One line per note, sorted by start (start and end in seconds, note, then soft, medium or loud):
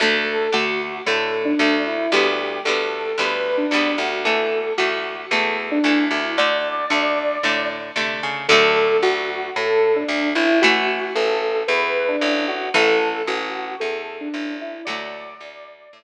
0.00 0.48 D2 loud
0.00 0.49 D3 medium
0.00 0.49 A3 loud
0.00 0.50 A4 medium
0.52 1.01 D2 medium
0.52 1.00 D3 medium
0.52 1.00 A3 medium
0.52 0.98 F#4 medium
1.06 1.54 A2 medium
1.06 1.54 D3 medium
1.06 1.54 A3 medium
1.06 1.41 A4 medium
1.45 1.82 D4 medium
1.59 2.07 D2 medium
1.59 2.07 D3 medium
1.59 2.07 A3 medium
1.87 2.11 E4 medium
2.12 2.60 D2 loud
2.12 2.60 D3 medium
2.12 2.60 G3 medium
2.12 2.60 B3 medium
2.12 2.60 G4 loud
2.65 3.13 D2 medium
2.65 3.13 D3 medium
2.65 3.13 G3 medium
2.65 3.13 B3 medium
2.65 3.16 A4 medium
3.18 3.67 D2 medium
3.18 3.65 D3 medium
3.18 3.65 G3 medium
3.18 3.65 B3 medium
3.18 3.57 B4 medium
3.57 3.95 D4 medium
3.71 3.96 D2 medium
3.71 4.20 D3 medium
3.71 4.20 G3 medium
3.71 4.20 B3 medium
3.98 4.72 D2 medium
3.98 4.21 F#4 medium
4.25 4.73 E3 medium
4.25 4.73 A3 medium
4.25 4.73 A4 medium
4.78 5.26 D2 medium
4.78 5.26 E3 medium
4.78 5.26 A3 medium
4.78 5.21 F#4 medium
5.30 5.79 E2 medium
5.30 5.79 E3 medium
5.30 5.79 A3 medium
5.30 5.62 A4 medium
5.71 6.04 D4 medium
5.84 6.09 D2 medium
5.84 6.32 E3 medium
5.84 6.32 A3 medium
6.11 6.85 D2 medium
6.11 6.34 E4 medium
6.38 6.86 D3 medium
6.38 6.86 A3 medium
6.38 7.68 D5 loud
6.90 7.38 D2 medium
6.90 7.38 D3 medium
6.90 7.38 A3 medium
7.43 7.91 A2 medium
7.43 7.92 D3 medium
7.43 7.92 A3 medium
7.96 8.20 C3 medium
7.96 8.44 D3 medium
7.96 8.44 A3 medium
8.23 8.47 C#3 medium
8.48 8.97 D2 loud
8.48 10.40 D3 loud
8.48 10.40 F#3 loud
8.48 10.40 A3 loud
8.48 8.97 A4 loud
9.03 9.50 D2 medium
9.03 9.48 F#4 loud
9.56 10.04 A2 medium
9.56 9.96 A4 loud
9.96 10.29 D4 loud
10.08 10.34 D2 medium
10.35 11.10 A1 medium
10.35 10.59 E4 loud
10.62 12.54 E3 loud
10.62 12.54 A3 loud
10.62 11.05 F#4 loud
11.15 11.63 A1 medium
11.15 11.58 A4 loud
11.68 12.16 E2 loud
11.68 12.04 B4 loud
12.08 12.46 D4 loud
12.21 12.69 A1 medium
12.48 12.70 F#4 loud
12.74 13.22 A1 loud
12.74 14.65 E3 loud
12.74 14.65 A3 loud
12.74 13.22 A4 loud
13.27 13.75 A1 medium
13.27 13.79 F#4 loud
13.80 14.29 E2 medium
13.80 14.13 A4 loud
14.20 14.56 D4 loud
14.34 14.82 A1 medium
14.61 14.85 E4 loud
14.85 15.35 D2 loud
14.85 16.03 D3 loud
14.85 16.03 F#3 loud
14.85 15.97 D5 loud
14.89 16.03 A3 loud
15.40 15.88 D2 medium
15.93 16.03 A2 medium